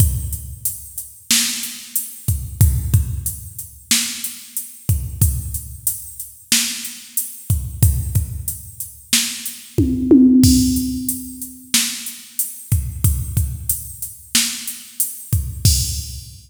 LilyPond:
\new DrumStaff \drummode { \time 4/4 \tempo 4 = 92 <hh bd>8 hh8 hh8 hh8 sn8 hh8 hh8 <hh bd>8 | <hh bd>8 <hh bd>8 hh8 hh8 sn8 hh8 hh8 <hh bd>8 | <hh bd>8 hh8 hh8 hh8 sn8 hh8 hh8 <hh bd>8 | <hh bd>8 <hh bd>8 hh8 hh8 sn8 hh8 <bd tommh>8 tommh8 |
<cymc bd>8 hh8 hh8 hh8 sn8 hh8 hh8 <hh bd>8 | <hh bd>8 <hh bd>8 hh8 hh8 sn8 hh8 hh8 <hh bd>8 | <cymc bd>4 r4 r4 r4 | }